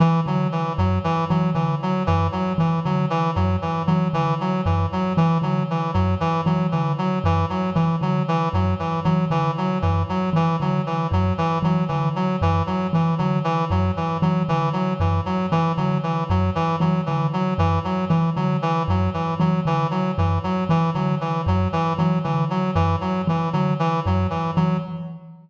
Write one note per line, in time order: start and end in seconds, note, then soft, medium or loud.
0.00 0.20 E3 medium
0.00 0.21 E3 medium
0.26 0.47 D3 medium
0.26 0.48 F#3 medium
0.52 0.73 E3 medium
0.78 0.99 F#2 medium
0.78 0.99 F#3 medium
1.04 1.25 E3 medium
1.30 1.51 E3 medium
1.30 1.50 F#3 medium
1.54 1.75 D3 medium
1.54 1.75 E3 medium
1.82 2.03 F#3 medium
2.07 2.29 F#2 medium
2.07 2.27 E3 medium
2.32 2.53 F#3 medium
2.58 2.79 E3 medium
2.58 2.80 E3 medium
2.85 3.06 D3 medium
2.85 3.06 F#3 medium
3.10 3.31 E3 medium
3.36 3.57 F#2 medium
3.36 3.56 F#3 medium
3.62 3.82 E3 medium
3.87 4.09 E3 medium
3.87 4.08 F#3 medium
4.13 4.34 D3 medium
4.13 4.34 E3 medium
4.41 4.61 F#3 medium
4.66 4.86 F#2 medium
4.66 4.86 E3 medium
4.92 5.13 F#3 medium
5.17 5.38 E3 medium
5.42 5.62 D3 medium
5.42 5.63 F#3 medium
5.70 5.91 E3 medium
5.94 6.16 F#2 medium
5.94 6.15 F#3 medium
6.20 6.41 E3 medium
6.46 6.67 E3 medium
6.46 6.67 F#3 medium
6.72 6.94 D3 medium
6.72 6.92 E3 medium
6.98 7.19 F#3 medium
7.24 7.45 F#2 medium
7.24 7.46 E3 medium
7.49 7.70 F#3 medium
7.75 7.96 E3 medium
8.01 8.22 D3 medium
8.01 8.23 F#3 medium
8.28 8.49 E3 medium
8.53 8.74 F#2 medium
8.53 8.74 F#3 medium
8.79 9.00 E3 medium
9.04 9.26 E3 medium
9.04 9.25 F#3 medium
9.30 9.51 D3 medium
9.30 9.51 E3 medium
9.58 9.78 F#3 medium
9.82 10.04 F#2 medium
9.82 10.03 E3 medium
10.09 10.30 F#3 medium
10.33 10.54 E3 medium
10.33 10.56 E3 medium
10.60 10.81 D3 medium
10.60 10.82 F#3 medium
10.86 11.07 E3 medium
11.11 11.32 F#2 medium
11.11 11.33 F#3 medium
11.38 11.59 E3 medium
11.62 11.83 E3 medium
11.62 11.84 F#3 medium
11.88 12.10 D3 medium
11.88 12.09 E3 medium
12.16 12.36 F#3 medium
12.41 12.62 F#2 medium
12.41 12.63 E3 medium
12.67 12.87 F#3 medium
12.93 13.14 E3 medium
12.93 13.15 E3 medium
13.18 13.40 D3 medium
13.18 13.39 F#3 medium
13.44 13.65 E3 medium
13.70 13.91 F#2 medium
13.70 13.91 F#3 medium
13.97 14.17 E3 medium
14.22 14.43 E3 medium
14.22 14.43 F#3 medium
14.49 14.69 D3 medium
14.49 14.69 E3 medium
14.73 14.94 F#3 medium
15.00 15.20 F#2 medium
15.00 15.21 E3 medium
15.26 15.46 F#3 medium
15.52 15.72 E3 medium
15.52 15.73 E3 medium
15.77 15.98 D3 medium
15.77 15.98 F#3 medium
16.03 16.24 E3 medium
16.30 16.50 F#2 medium
16.30 16.50 F#3 medium
16.55 16.76 E3 medium
16.80 17.01 E3 medium
16.80 17.01 F#3 medium
17.06 17.29 D3 medium
17.06 17.27 E3 medium
17.33 17.54 F#3 medium
17.58 17.79 F#2 medium
17.58 17.79 E3 medium
17.84 18.05 F#3 medium
18.09 18.30 E3 medium
18.09 18.31 E3 medium
18.36 18.57 D3 medium
18.36 18.57 F#3 medium
18.62 18.83 E3 medium
18.88 19.09 F#2 medium
18.88 19.10 F#3 medium
19.14 19.34 E3 medium
19.40 19.60 E3 medium
19.40 19.60 F#3 medium
19.65 19.86 D3 medium
19.65 19.87 E3 medium
19.91 20.11 F#3 medium
20.18 20.39 F#2 medium
20.18 20.39 E3 medium
20.44 20.64 F#3 medium
20.69 20.90 E3 medium
20.94 21.16 D3 medium
20.94 21.15 F#3 medium
21.21 21.41 E3 medium
21.46 21.67 F#2 medium
21.46 21.68 F#3 medium
21.73 21.93 E3 medium
21.98 22.19 E3 medium
21.98 22.19 F#3 medium
22.24 22.46 D3 medium
22.24 22.45 E3 medium
22.50 22.71 F#3 medium
22.75 22.96 F#2 medium
22.75 22.96 E3 medium
23.01 23.22 F#3 medium
23.27 23.48 E3 medium
23.27 23.49 E3 medium
23.53 23.74 D3 medium
23.53 23.74 F#3 medium
23.79 24.00 E3 medium
24.06 24.27 F#2 medium
24.06 24.27 F#3 medium
24.30 24.51 E3 medium
24.56 24.78 E3 medium
24.56 24.77 F#3 medium